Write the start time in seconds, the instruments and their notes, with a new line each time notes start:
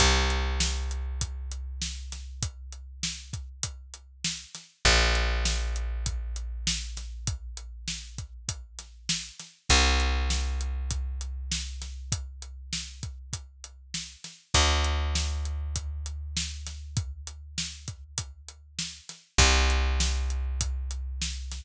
0.00 electric bass (finger) C2, kick, closed hi-hat
0.30 closed hi-hat
0.60 snare
0.91 closed hi-hat
1.21 kick, closed hi-hat
1.52 closed hi-hat
1.82 snare
2.12 snare, closed hi-hat
2.43 kick, closed hi-hat
2.72 closed hi-hat
3.03 snare
3.33 kick, closed hi-hat
3.63 kick, closed hi-hat
3.94 closed hi-hat
4.24 snare
4.55 snare, closed hi-hat
4.85 electric bass (finger) A#1, kick, closed hi-hat
5.15 snare, closed hi-hat
5.45 snare
5.76 closed hi-hat
6.06 kick, closed hi-hat
6.36 closed hi-hat
6.67 snare
6.97 snare, closed hi-hat
7.27 kick, closed hi-hat
7.57 closed hi-hat
7.88 snare
8.18 kick, closed hi-hat
8.49 kick, closed hi-hat
8.79 snare, closed hi-hat
9.09 snare
9.40 snare, closed hi-hat
9.69 electric bass (finger) C2, kick, closed hi-hat
10.00 closed hi-hat
10.30 snare
10.61 closed hi-hat
10.91 kick, closed hi-hat
11.21 closed hi-hat
11.52 snare
11.82 snare, closed hi-hat
12.12 kick, closed hi-hat
12.42 closed hi-hat
12.73 snare
13.03 kick, closed hi-hat
13.33 kick, closed hi-hat
13.64 closed hi-hat
13.94 snare
14.24 snare, closed hi-hat
14.54 electric bass (finger) D2, kick, closed hi-hat
14.84 closed hi-hat
15.15 snare
15.45 closed hi-hat
15.76 kick, closed hi-hat
16.06 closed hi-hat
16.37 snare
16.67 snare, closed hi-hat
16.97 kick, closed hi-hat
17.27 closed hi-hat
17.58 snare
17.88 kick, closed hi-hat
18.18 kick, closed hi-hat
18.48 closed hi-hat
18.79 snare
19.09 snare, closed hi-hat
19.38 electric bass (finger) C2, kick, closed hi-hat
19.70 closed hi-hat
20.00 snare
20.30 closed hi-hat
20.61 kick, closed hi-hat
20.91 closed hi-hat
21.22 snare
21.52 snare, closed hi-hat